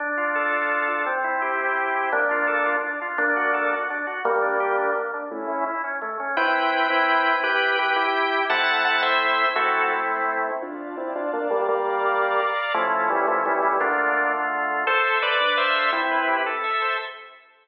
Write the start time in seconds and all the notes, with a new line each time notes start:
0.00 D4
0.17 F4
0.35 A4
0.52 F4
0.71 D4
0.88 F4
1.06 C4
1.24 E4
1.42 G4
1.59 E4
1.77 C4
1.95 E4
2.12 A#3 D4
2.31 F4
2.47 A4
2.66 F4
2.84 D4
3.01 F4
3.18 A#3 D4
3.36 F#4
3.54 A4
3.71 F#4
3.90 D4
4.07 F#4
4.25 G3 A#3
4.42 D4
4.60 G4
4.77 D4
4.96 A#3
5.13 D4
5.31 A3 C#4 E4
5.49 C#4
5.66 E4
5.84 C#4
6.02 A3
6.20 C#4
6.37 C4 E4 B4 G5
6.90 C4 E4
7.44 E4 G4 B4 G5
7.79 G4 B4
7.96 E4 G4
8.50 A3 C4 E4 F#5 A5
8.85 F#5 A5
9.03 C5 E5
9.56 A3 C4 E4 F#4 A4
10.62 D4 F4 D5 F5 A5
10.97 C4 E4
11.15 D4 F4
11.33 A#3 D4
11.50 G3 A#3
11.68 G3 A#3 D5 F5 A#5
12.74 F3 A3 C#4 E4
13.10 E3 G3
13.28 F3 A3
13.46 E3 G3
13.63 E3 G3
13.80 D3 A3 A#3 D4 F4
14.87 A4 C5
15.04 E5
15.22 B4 C5 D5
15.40 D4
15.57 C5 E5 F5
15.76 A4
15.92 C4 E4
16.11 B4
16.28 G4
16.46 A4
16.64 E5
16.82 C5